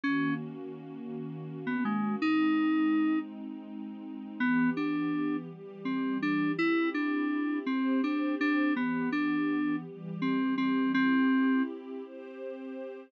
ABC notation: X:1
M:6/8
L:1/16
Q:3/8=55
K:C#dor
V:1 name="Electric Piano 2"
C2 z7 B, G,2 | D6 z6 | [K:Ddor] B,2 D4 z2 C2 D2 | E2 D4 C2 D2 D2 |
B,2 D4 z2 C2 C2 | C4 z8 |]
V:2 name="Pad 2 (warm)"
[D,A,CF]12 | [G,^B,D]12 | [K:Ddor] [E,B,G]6 [E,G,G]6 | [CEG]6 [CGc]6 |
[E,B,G]6 [E,G,G]6 | [CEG]6 [CGc]6 |]